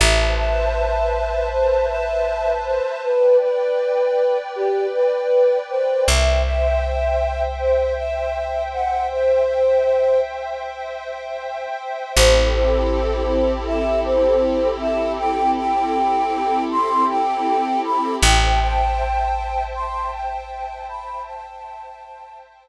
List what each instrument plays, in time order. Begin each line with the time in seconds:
0.00 electric bass (finger) A1, pad 5 (bowed) B4 C5 E5 A5, choir aahs E5
0.38 choir aahs E5
1.52 choir aahs C5
1.90 choir aahs E5
2.66 choir aahs C5
3.04 choir aahs B4, pad 5 (bowed) B4 D5 G5
3.42 choir aahs B4
4.56 choir aahs G4
4.94 choir aahs B4
5.70 choir aahs C5
6.08 electric bass (finger) C2, pad 5 (bowed) C5 E5 G5, choir aahs E5
6.45 choir aahs E5
7.59 choir aahs C5
7.97 choir aahs E5
8.73 choir aahs F#5
9.12 choir aahs C5
12.15 electric bass (finger) A1, pad 5 (bowed) C4 E4 G4 A4, choir aahs C5
12.53 choir aahs C5
13.67 choir aahs E5
14.05 choir aahs C5
14.81 choir aahs E5
15.19 choir aahs G5
15.57 choir aahs G5
16.71 choir aahs C6
17.09 choir aahs G5
17.85 choir aahs B5
18.22 electric bass (finger) A1, pad 5 (bowed) C5 E5 G5 A5, choir aahs G5
18.61 choir aahs G5
19.75 choir aahs C6
20.13 choir aahs G5
20.89 choir aahs B5
21.26 choir aahs A5